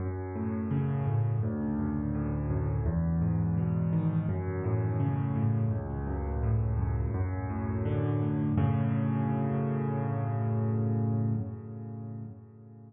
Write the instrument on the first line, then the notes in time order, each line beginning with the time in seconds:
acoustic grand piano
0.00 F#2
0.35 A2
0.71 C#3
1.07 A2
1.43 D2
1.79 F#2
2.14 A2
2.50 F#2
2.86 E2
3.21 G#2
3.57 B2
3.93 D#3
4.29 F#2
4.64 A2
5.00 C#3
5.36 A2
5.71 C#2
6.07 F#2
6.43 A2
6.79 F#2
7.14 F#2
7.50 A2
7.85 D3
8.22 A2
8.58 F#2 A2 C#3